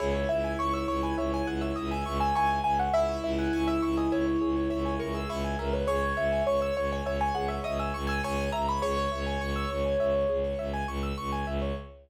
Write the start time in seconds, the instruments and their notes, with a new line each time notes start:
0.00 violin C#2, acoustic grand piano E4 G#4 C#5
0.15 acoustic grand piano C#5
0.29 violin C#2, acoustic grand piano E5
0.44 acoustic grand piano G#5
0.59 violin C#2, acoustic grand piano C#5 C#6
0.74 acoustic grand piano C#5 E6
0.88 violin C#2, acoustic grand piano C#5 C#6
1.03 acoustic grand piano B4 G#5
1.17 violin C#2, acoustic grand piano C#5 E5
1.32 acoustic grand piano C#5 G#5
1.47 violin C#2, acoustic grand piano G#4 F#5
1.61 acoustic grand piano C#5 E5
1.76 violin C#2, acoustic grand piano D#5 E5
1.91 acoustic grand piano E5 G#5
2.06 violin C#2, acoustic grand piano C#6
2.20 acoustic grand piano G#5 E6
2.35 violin C#2, acoustic grand piano E4 G#5 C#6
2.50 acoustic grand piano G#5
2.64 violin C#2, acoustic grand piano E5 G#5
2.79 acoustic grand piano C#5 F#5
2.93 violin C#2, acoustic grand piano E4 G#4 E5
3.09 acoustic grand piano C#5
3.23 violin C#2, acoustic grand piano E5
3.38 acoustic grand piano F#5 G#5
3.53 violin C#2, acoustic grand piano G#5 C#6
3.68 acoustic grand piano E5 E6
3.82 violin C#2, acoustic grand piano E5 C#6
3.97 acoustic grand piano D#5 G#5
4.11 violin C#2, acoustic grand piano C#5 E5
4.26 acoustic grand piano C#5
4.41 violin C#2, acoustic grand piano G#4
4.56 acoustic grand piano C#5
4.70 violin C#2, acoustic grand piano C#5 E5
4.85 acoustic grand piano G#5
4.99 violin C#2, acoustic grand piano A#4 C#6
5.14 acoustic grand piano G#4 E6
5.29 violin C#2, acoustic grand piano E4 C#6
5.44 acoustic grand piano G#5
5.59 violin C#2, acoustic grand piano A#4 E5
5.73 acoustic grand piano B4 C#5
5.87 violin C#2, acoustic grand piano G#4 C#5
6.03 acoustic grand piano C#5
6.17 violin C#2, acoustic grand piano E5
6.32 acoustic grand piano G#5
6.46 violin C#2, acoustic grand piano C#5 C#6
6.61 acoustic grand piano C#5 E6
6.76 violin C#2, acoustic grand piano C#5 C#6
6.91 acoustic grand piano C#5 G#5
7.06 violin C#2, acoustic grand piano C#5 E5
7.21 acoustic grand piano C#5 G#5
7.34 violin C#2, acoustic grand piano G#4 F#5
7.48 acoustic grand piano C#5 E5
7.64 violin C#2, acoustic grand piano D#5 E5
7.79 acoustic grand piano E5 G#5
7.94 violin C#2, acoustic grand piano C#6
8.07 acoustic grand piano G#5 E6
8.24 violin C#2, acoustic grand piano C#5 G#5 C#6
8.38 acoustic grand piano G#5
8.52 violin C#2, acoustic grand piano E5 A#5
8.68 acoustic grand piano C#5 B5
8.82 violin C#2, acoustic grand piano G#4 C#5
8.97 acoustic grand piano C#5
9.12 violin C#2, acoustic grand piano E5
9.26 acoustic grand piano G#5
9.41 violin C#2, acoustic grand piano C#6
9.56 acoustic grand piano E6
9.70 violin C#2, acoustic grand piano C#6
9.85 acoustic grand piano G#5
10.00 violin C#2, acoustic grand piano E5
10.15 acoustic grand piano C#5
10.29 violin C#2, acoustic grand piano G#4
10.44 acoustic grand piano C#5
10.59 violin C#2, acoustic grand piano E5
10.74 acoustic grand piano G#5
10.87 violin C#2, acoustic grand piano C#6
11.03 acoustic grand piano E6
11.18 violin C#2, acoustic grand piano C#6
11.32 acoustic grand piano G#5
11.47 violin C#2, acoustic grand piano E5
11.62 acoustic grand piano C#5